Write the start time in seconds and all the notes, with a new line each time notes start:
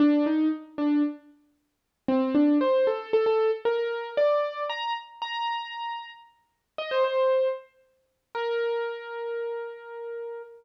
0.00 D4
0.26 D#4
0.78 D4
2.08 C4
2.35 D4
2.61 C5
2.87 A4
3.13 A4
3.26 A4
3.65 A#4
4.17 D5
4.69 A#5
5.22 A#5
6.78 D#5
6.91 C5
7.04 C5
8.35 A#4